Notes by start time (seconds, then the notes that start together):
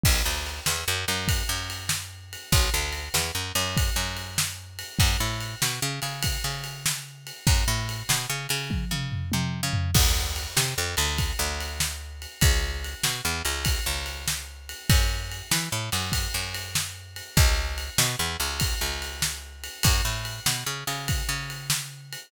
0.04 B1, kick, crash
0.26 D2
0.46 ride
0.66 E2, snare
0.88 F#2
1.08 F#2, ride
1.28 kick, ride
1.49 F#2
1.70 ride
1.89 snare
2.33 ride
2.52 B1, kick, ride
2.74 D2
2.93 ride
3.14 E2, snare
3.35 F#2
3.55 F#2, ride
3.77 kick, ride
3.96 F#2
4.17 ride
4.38 snare
4.79 ride
4.99 F#2, kick, ride
5.20 A2
5.40 ride
5.62 B2, snare
5.82 C#3
6.02 C#3, ride
6.23 kick, ride
6.44 C#3
6.64 ride
6.86 snare
7.27 ride
7.47 F#2, kick, ride
7.68 A2
7.89 ride
8.09 B2, snare
8.30 C#3
8.49 C#3, ride
8.70 kick, high tom
8.91 C#3, mid tom
9.12 floor tom
9.32 C3, high tom
9.63 C#3
9.73 floor tom
9.94 D2, kick, crash
10.36 ride
10.57 C3, snare
10.78 F2
10.97 D2, ride
11.18 kick, ride
11.39 D2
11.60 ride
11.80 snare
12.22 ride
12.41 C#2, kick, ride
12.84 ride
13.03 B2, snare
13.25 E2
13.45 C#2, ride
13.65 kick, ride
13.86 C#2
14.06 ride
14.28 snare
14.69 ride
14.90 F#2, kick, ride
15.31 ride
15.51 E3, snare
15.72 A2
15.92 F#2, ride
16.12 kick, ride
16.34 F#2
16.54 ride
16.75 snare
17.16 ride
17.37 C#2, kick, ride
17.78 ride
17.98 B2, snare
18.19 E2
18.40 C#2, ride
18.60 kick, ride
18.81 C#2
19.02 ride
19.22 snare
19.64 ride
19.83 F#2, kick, ride
20.05 A2
20.25 ride
20.46 B2, snare
20.66 C#3
20.87 C#3, ride
21.08 kick, ride
21.29 C#3
21.50 ride
21.70 snare
22.13 ride